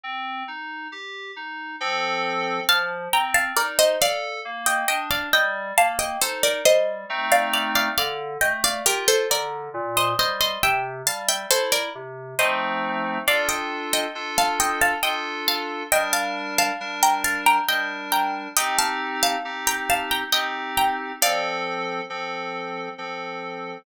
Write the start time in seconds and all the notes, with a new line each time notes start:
0.03 C4
0.48 D#4
0.92 G4
1.36 D#4
1.81 F3 C4 A4
2.69 F3 F5 A5
3.13 C4 G5 A#5
3.34 F5 A5
3.57 D#4 A#4 D5
3.79 C5 D#5
4.01 A4 D5 F5
4.45 A#3
4.66 D#5 G5
4.88 D4 D#5 G5
5.11 D5 F5
5.33 G3 D#5 G5
5.77 A#3 F5 A5
5.99 D#5 G5
6.22 D#4 A4 C5
6.43 A#4 D5
6.65 G3 C5 D#5
7.10 A3 C4 D#4
7.32 D5 F5
7.53 D5 F5
7.76 D5 F5
7.98 D3 D5 F5
8.41 A3 D#5 G5
8.64 D5 F5
8.86 F4 G4 A#4
9.08 A4 C5
9.30 D3 A#4 D5
9.74 A#2
9.97 C5 D#5
10.18 G3 C5 D#5
10.41 C5 D#5
10.63 C3 E5 G5
11.06 G3 F5 A5
11.28 E5 G5
11.50 E4 A4 C5
11.72 A#4 D5
11.95 C3
12.39 F3 A3 C4 D#4 C5 D#5
13.27 D4 F4 A4 D5 F5
13.49 D#5 G5
13.93 D#5 G5
14.15 D4 F4 A4
14.38 F5 A5
14.60 D#5 G5
14.81 F5 A5
15.03 D4 F4 A4 D#5 G5
15.48 F5 A5
15.92 G3 D4 A#4 D#5 G5
16.13 F5 A5
16.58 F5 A5
16.81 G3 D4 A#4
17.03 G5 A#5
17.24 F5 A5
17.46 G5 A#5
17.69 G3 D4 A#4 D#5 G5
18.12 G5 A#5
18.57 C4 D#4 G4 D#5 G5
18.78 F5 A5
19.23 F5 A5
19.45 C4 D#4 G4
19.67 G5 A#5
19.90 F5 A5
20.11 G5 A#5
20.33 C4 D#4 G4 D#5 G5
20.77 G5 A#5
21.22 F3 C4 A4 D5 F5
22.10 F3 C4 A4
22.98 F3 C4 A4